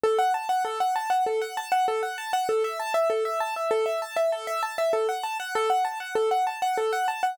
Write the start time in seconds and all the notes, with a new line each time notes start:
0.04 A4
0.18 F#5
0.34 A5
0.49 F#5
0.65 A4
0.80 F#5
0.96 A5
1.10 F#5
1.26 A4
1.41 F#5
1.57 A5
1.72 F#5
1.88 A4
2.03 F#5
2.18 A5
2.33 F#5
2.49 A4
2.64 E5
2.79 A5
2.94 E5
3.10 A4
3.25 E5
3.40 A5
3.56 E5
3.71 A4
3.86 E5
4.02 A5
4.16 E5
4.32 A4
4.47 E5
4.63 A5
4.78 E5
4.93 A4
5.09 F#5
5.23 A5
5.40 F#5
5.55 A4
5.70 F#5
5.85 A5
6.00 F#5
6.15 A4
6.31 F#5
6.47 A5
6.62 F#5
6.78 A4
6.93 F#5
7.08 A5
7.23 F#5